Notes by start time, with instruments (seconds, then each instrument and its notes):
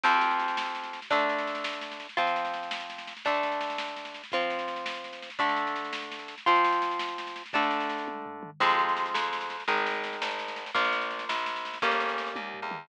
0.03 acoustic guitar (steel) F2 F3 C4, kick, snare, crash
0.13 snare
0.21 snare
0.31 snare
0.40 snare
0.48 snare
0.57 snare
0.66 snare
0.75 snare
0.83 snare
0.93 snare
1.02 snare
1.10 acoustic guitar (steel) D3 A3 D4, kick, snare
1.19 snare
1.29 snare
1.38 snare
1.47 snare
1.55 snare
1.64 snare
1.73 snare
1.81 snare
1.91 snare
2.00 snare
2.09 snare
2.17 acoustic guitar (steel) F3 C4 F4, kick, snare
2.27 snare
2.36 snare
2.45 snare
2.54 snare
2.63 snare
2.71 snare
2.80 snare
2.90 snare
2.98 snare
3.07 snare
3.17 snare
3.25 acoustic guitar (steel) D3 A3 D4, kick, snare
3.34 snare
3.43 snare
3.52 snare
3.61 snare
3.70 snare
3.78 snare
3.88 snare
3.96 snare
4.05 snare
4.14 snare
4.23 snare
4.32 acoustic guitar (steel) F3 C4 F4, kick, snare
4.41 snare
4.50 snare
4.59 snare
4.68 snare
4.76 snare
4.86 snare
4.94 snare
5.04 snare
5.13 snare
5.22 snare
5.30 snare
5.39 acoustic guitar (steel) D3 A3 D4, kick, snare
5.49 snare
5.56 snare
5.67 snare
5.76 snare
5.85 snare
5.93 snare
6.02 snare
6.11 snare
6.19 snare
6.28 snare
6.38 snare
6.46 acoustic guitar (steel) F3 C4 F4, kick, snare
6.55 snare
6.65 snare
6.72 snare
6.82 snare
6.91 snare
6.99 snare
7.08 snare
7.18 snare
7.27 snare
7.36 snare
7.46 snare
7.53 acoustic guitar (steel) D3 A3 D4, kick, snare
7.62 snare
7.71 snare
7.80 snare
7.89 snare
7.98 snare
8.08 kick, high tom
8.26 floor tom
8.43 mid tom
8.60 electric bass (finger) F2, acoustic guitar (steel) F3 G#3 C4, kick, snare, crash
8.70 snare
8.79 snare
8.88 snare
8.97 snare
9.06 snare
9.14 electric bass (finger) F2, snare
9.23 snare
9.33 snare
9.41 snare
9.50 snare
9.60 snare
9.68 electric bass (finger) G#1, acoustic guitar (steel) D#3 G#3, kick, snare
9.77 snare
9.87 snare
9.94 snare
10.04 snare
10.13 snare
10.22 electric bass (finger) G#1, snare
10.31 snare
10.39 snare
10.48 snare
10.56 snare
10.66 snare
10.74 electric bass (finger) A#1, acoustic guitar (steel) F3 A#3, kick, snare
10.85 snare
10.92 snare
11.01 snare
11.10 snare
11.19 snare
11.29 electric bass (finger) A#1, snare
11.38 snare
11.46 snare
11.56 snare
11.65 snare
11.74 snare
11.82 electric bass (finger) G1, acoustic guitar (steel) G3 A#3 C#4, kick, snare
11.91 snare
12.00 snare
12.09 snare
12.18 snare
12.27 snare
12.35 electric bass (finger) D#2, kick, high tom
12.54 floor tom
12.62 electric bass (finger) E2
12.71 mid tom